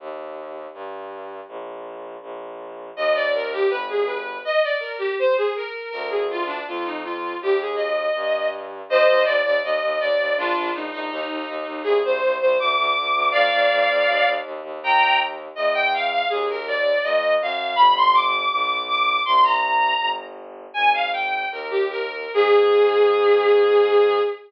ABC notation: X:1
M:2/2
L:1/8
Q:1/2=81
K:Eb
V:1 name="Violin"
z8 | z8 | e d B G =B A B2 | e d B G c A B2 |
B A F D F E F2 | G A e4 z2 | [ce]2 d d e2 d2 | [DF]2 E E E2 E2 |
A c2 c d'4 | [df]6 z2 | [gb]2 z2 e g f f | A B d2 e2 f2 |
=b c' d'2 d'2 d'2 | c' b4 z3 | [K:Ab] "^rit." a f g2 B G B2 | A8 |]
V:2 name="Violin" clef=bass
E,,4 G,,4 | B,,,4 B,,,4 | E,,4 G,,,4 | z8 |
D,,4 F,,4 | E,,4 G,,4 | E,, E,, E,, E,, E,, E,, E,, E,, | B,,, B,,, B,,, B,,, E,, E,, E,, E,, |
C,, C,, C,, C,, D,, D,, D,, D,, | F,, F,, F,, F,, E,, E,, E,, E,, | E,,4 =E,,4 | E,,4 F,,2 _G,,2 |
G,,,4 =B,,,4 | C,,4 G,,,4 | [K:Ab] "^rit." A,,,4 E,,4 | A,,8 |]